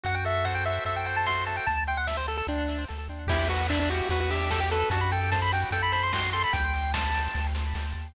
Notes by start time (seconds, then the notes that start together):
0.03 F#2 F#4 F#5, kick, closed hi-hat
0.15 G5
0.25 A4 E5, open hi-hat
0.45 C5 F#5, kick, snare
0.55 G5
0.65 F#4 E5, open hi-hat
0.85 F#2 A4 E5, kick, closed hi-hat
0.96 G5
1.06 C5 G5, open hi-hat
1.16 A5
1.26 F#4 C6, kick, snare
1.46 A4 A5, open hi-hat
1.57 G5
1.66 D2 A5, kick, closed hi-hat
1.87 G5, open hi-hat
1.97 F#5
2.07 E5, kick, snare
2.17 C5
2.28 A4, open hi-hat
2.37 A4
2.47 D2 D4, kick, snare
2.68 snare
2.89 D2, snare
3.09 D#2
3.27 E2 E4 G4, kick, crash
3.48 F#4 B4, open hi-hat
3.69 D4 E5, kick, clap
3.80 D4
3.90 F#4 G4, open hi-hat
4.09 E2 F#4 B4, kick, closed hi-hat
4.20 F#4
4.30 G4 E5, open hi-hat
4.50 G4 A4, kick, snare
4.60 G4
4.71 A4 B4, open hi-hat
4.90 F#2 F#4 A5, kick, closed hi-hat
5.01 B5
5.11 A4 G5, open hi-hat
5.31 C5 A5, kick, snare
5.42 B5
5.52 F#4 G5, open hi-hat
5.71 F#2 A4 G5, kick, closed hi-hat
5.82 B5
5.92 C5 B5, open hi-hat
6.03 C6
6.13 F#4 C6, kick, snare
6.33 A4 C6, open hi-hat
6.44 B5
6.53 D2 G5, kick, closed hi-hat
6.74 open hi-hat
6.93 A5, kick, snare
7.14 open hi-hat
7.34 D2, kick, snare
7.55 snare
7.75 D2, snare
7.95 D#2